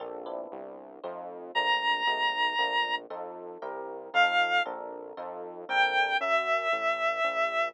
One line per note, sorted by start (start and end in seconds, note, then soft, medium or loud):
0.00 0.47 A#1 medium
0.00 0.25 A#3 loud
0.00 0.25 C4 loud
0.00 0.25 D4 loud
0.00 0.25 A4 medium
0.26 0.98 B3 medium
0.26 0.98 C4 loud
0.26 0.98 D4 loud
0.26 0.98 E4 loud
0.52 1.00 C2 medium
1.04 1.52 F2 medium
1.04 1.50 A3 medium
1.04 1.50 C4 loud
1.04 1.50 D#4 loud
1.04 1.50 F4 medium
1.55 2.03 A#1 medium
1.55 2.02 A3 loud
1.55 2.02 A#3 loud
1.55 2.02 C4 loud
1.55 2.02 D4 loud
1.55 2.95 A#5 medium
2.07 2.54 B1 medium
2.07 2.54 G#3 loud
2.07 2.54 A3 loud
2.07 2.54 B3 loud
2.07 2.54 D#4 loud
2.59 3.06 A#1 medium
2.59 3.05 A3 loud
2.59 3.05 A#3 loud
2.59 3.05 C4 medium
2.59 3.05 D4 medium
3.10 3.58 F2 medium
3.10 3.57 C4 loud
3.10 3.57 D#4 loud
3.10 3.57 F4 medium
3.10 3.57 A4 loud
3.62 4.10 C2 medium
3.62 4.09 C4 loud
3.62 4.09 E4 medium
3.62 4.09 G4 medium
3.62 4.09 A#4 loud
4.14 4.61 F2 medium
4.14 4.60 C4 loud
4.14 4.60 D#4 loud
4.14 4.60 F4 loud
4.14 4.60 A4 loud
4.14 4.63 F5 medium
4.66 5.13 A#1 medium
4.66 5.12 C4 loud
4.66 5.12 D4 loud
4.66 5.12 A4 loud
4.66 5.12 A#4 loud
5.17 5.65 F2 medium
5.17 5.64 C4 loud
5.17 5.64 D#4 loud
5.17 5.64 F4 loud
5.17 5.64 A4 loud
5.69 6.17 A#1 medium
5.69 6.16 C4 loud
5.69 6.16 D4 loud
5.69 6.16 A4 loud
5.69 6.16 A#4 loud
5.69 6.17 G5 medium
6.20 6.68 F#2 medium
6.20 7.68 E5 medium
6.72 7.20 A1 medium
7.24 7.71 A#1 medium